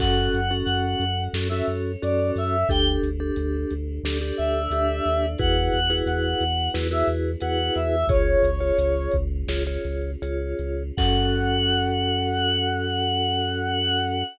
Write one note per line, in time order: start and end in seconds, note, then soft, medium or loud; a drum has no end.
0.00 0.29 F#2 loud
0.00 0.41 C#4 loud
0.00 1.33 C#4 medium
0.00 0.41 F#4 loud
0.00 1.34 F#4 medium
0.00 0.41 A4 loud
0.00 1.33 A4 medium
0.00 0.53 F#5 loud
0.00 kick loud
0.00 crash loud
0.34 0.63 F#2 loud
0.34 closed hi-hat medium
0.51 1.04 C#4 loud
0.51 1.04 F#4 loud
0.51 1.04 A4 loud
0.65 0.95 F#2 loud
0.65 1.23 F#5 medium
0.65 closed hi-hat loud
1.00 1.28 F#2 loud
1.00 closed hi-hat medium
1.34 1.62 F#2 loud
1.34 2.67 C#4 medium
1.34 1.48 C#4 medium
1.34 1.48 F#4 medium
1.34 2.67 A4 medium
1.34 1.48 A4 loud
1.34 2.67 C#5 medium
1.34 snare loud
1.49 1.92 C#4 loud
1.49 1.92 F#4 loud
1.49 1.92 A4 loud
1.49 1.65 E5 medium
1.68 1.96 F#2 medium
1.68 closed hi-hat medium
2.02 2.32 F#2 loud
2.02 2.56 C#4 medium
2.02 2.56 F#4 loud
2.02 2.56 A4 loud
2.02 2.31 D5 medium
2.02 closed hi-hat loud
2.36 2.64 F#2 loud
2.36 2.68 E5 medium
2.36 open hi-hat medium
2.68 2.98 D2 loud
2.68 4.02 D4 medium
2.68 3.10 D4 loud
2.68 4.02 G4 medium
2.68 3.10 G4 loud
2.68 4.02 A4 medium
2.68 3.10 A4 loud
2.68 2.86 G5 loud
2.68 kick loud
2.68 closed hi-hat loud
3.03 3.32 D2 medium
3.03 closed hi-hat medium
3.20 3.74 D4 loud
3.20 3.74 G4 loud
3.20 3.74 A4 loud
3.36 3.65 D2 loud
3.36 closed hi-hat loud
3.71 4.00 D2 loud
3.71 closed hi-hat medium
4.04 4.32 D2 loud
4.04 5.38 D4 medium
4.04 4.18 D4 loud
4.04 4.18 G4 loud
4.04 5.38 A4 medium
4.04 4.18 A4 loud
4.04 5.38 D5 medium
4.04 snare loud
4.21 4.62 D4 medium
4.21 4.62 G4 loud
4.21 4.62 A4 loud
4.37 4.68 D2 medium
4.37 5.26 E5 medium
4.37 closed hi-hat medium
4.71 5.01 D2 loud
4.71 5.26 D4 loud
4.71 5.26 G4 loud
4.71 5.26 A4 medium
4.71 closed hi-hat loud
5.05 5.36 D#2 loud
5.05 closed hi-hat medium
5.38 5.70 E2 loud
5.38 8.06 B3 medium
5.38 5.80 E4 loud
5.38 8.06 E4 medium
5.38 5.80 F#4 loud
5.38 8.06 F#4 medium
5.38 5.80 G#4 loud
5.38 8.06 G#4 medium
5.38 5.80 B4 loud
5.38 5.95 F#5 loud
5.38 kick loud
5.38 closed hi-hat loud
5.74 6.02 E2 medium
5.74 closed hi-hat medium
5.90 6.44 E4 loud
5.90 6.44 F#4 loud
5.90 6.44 G#4 loud
5.90 6.44 B4 loud
6.06 6.35 E2 loud
6.06 6.69 F#5 medium
6.06 closed hi-hat loud
6.41 6.69 E2 loud
6.41 closed hi-hat medium
6.74 7.03 E2 loud
6.74 6.88 E4 loud
6.74 6.88 F#4 loud
6.74 6.88 G#4 medium
6.74 6.88 B4 loud
6.74 snare loud
6.91 7.31 E4 loud
6.91 7.31 F#4 loud
6.91 7.31 G#4 medium
6.91 7.31 B4 loud
6.91 7.08 E5 medium
7.08 7.36 E2 loud
7.08 closed hi-hat medium
7.40 7.70 E2 loud
7.40 7.96 E4 loud
7.40 7.96 F#4 loud
7.40 7.96 G#4 medium
7.40 7.96 B4 loud
7.40 7.73 F#5 medium
7.40 closed hi-hat loud
7.74 8.04 E2 loud
7.74 8.06 E5 medium
7.74 closed hi-hat medium
8.07 8.36 C#2 loud
8.07 10.95 C#4 medium
8.07 8.50 F4 loud
8.07 10.95 F4 medium
8.07 8.50 G#4 loud
8.07 10.95 G#4 medium
8.07 8.50 C#5 loud
8.07 9.11 C#5 loud
8.07 kick loud
8.07 closed hi-hat loud
8.43 8.72 C#2 loud
8.43 closed hi-hat medium
8.60 9.16 F4 loud
8.60 9.16 G#4 medium
8.60 9.16 C#5 loud
8.78 9.08 C#2 loud
8.78 closed hi-hat loud
9.12 9.44 C#2 loud
9.12 kick medium
9.12 closed hi-hat medium
9.47 9.78 C#2 loud
9.47 9.63 F4 loud
9.47 9.63 G#4 loud
9.47 9.63 C#5 loud
9.47 snare loud
9.67 10.11 F4 medium
9.67 10.11 G#4 medium
9.67 10.11 C#5 medium
9.85 10.16 C#2 loud
9.85 closed hi-hat medium
10.22 10.54 C#2 loud
10.22 10.83 F4 loud
10.22 10.83 G#4 medium
10.22 10.83 C#5 medium
10.22 closed hi-hat loud
10.59 10.92 C#2 loud
10.59 closed hi-hat medium
10.97 14.23 F#2 loud
10.97 14.23 C#4 loud
10.97 14.23 C#4 medium
10.97 14.23 F#4 loud
10.97 14.23 A4 medium
10.97 14.23 A4 loud
10.97 14.22 F#5 loud
10.97 kick loud
10.97 crash loud